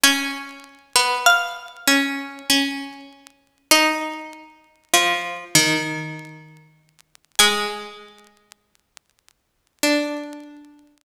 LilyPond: <<
  \new Staff \with { instrumentName = "Harpsichord" } { \time 3/4 \key fis \minor \tempo 4 = 49 gis''4 eis''4. r8 | dis''2. | gis''2. | }
  \new Staff \with { instrumentName = "Harpsichord" } { \time 3/4 \key fis \minor cis'8. b8. cis'8 cis'4 | dis'4 eis8 dis4 r8 | gis2 d'4 | }
>>